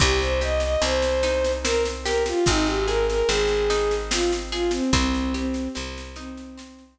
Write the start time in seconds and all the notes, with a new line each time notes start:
0.00 C2 C4 G4, kick, snare, crash
0.21 C5, snare
0.41 G4 D#5, snare
0.60 D#5, snare
0.82 C2 C4 C5, snare
1.02 snare
1.23 D#4, snare
1.45 snare
1.63 C4 A#4, snare
1.85 snare
2.04 G4 A#4, snare
2.26 F4, snare
2.46 G#1 C4 D#4, kick, snare
2.66 G4, snare
2.87 G#4 A#4, snare
3.09 A#4, snare
3.28 G#1 C4 G#4, snare
3.48 snare
3.70 D#4, snare
3.91 snare
4.11 C4 F4, snare
4.33 snare
4.52 F4 G#4, snare
4.71 C4, snare
4.93 C2 C4, kick, snare
5.14 snare
5.34 C4 G4, snare
5.54 snare
5.75 C2 C4, snare
5.98 snare
6.16 C4 D#4, snare
6.37 snare
6.58 C4, snare
6.79 snare